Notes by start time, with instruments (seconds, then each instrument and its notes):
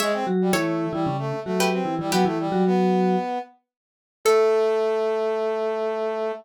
0.00 vibraphone G#3 G#4, brass section G#3, harpsichord C#5 E5
0.13 brass section C4
0.27 vibraphone F#3 F#4
0.41 brass section G3
0.53 vibraphone E3 E4, brass section A3, harpsichord A4 C#5
0.93 vibraphone E3 E4, brass section G3
1.06 vibraphone C#3 C#4
1.18 brass section A3
1.45 vibraphone F#3 F#4, brass section A3
1.60 harpsichord G4 B4
1.72 brass section C4
1.85 vibraphone E3 E4
1.99 vibraphone E3 E4, brass section G3
2.12 vibraphone F#3 F#4, brass section B3, harpsichord G4 B4
2.25 vibraphone E3 E4, brass section A3
2.39 brass section G3
2.52 vibraphone F#3 F#4
2.66 brass section B3
4.25 brass section A3, vibraphone A4, harpsichord A4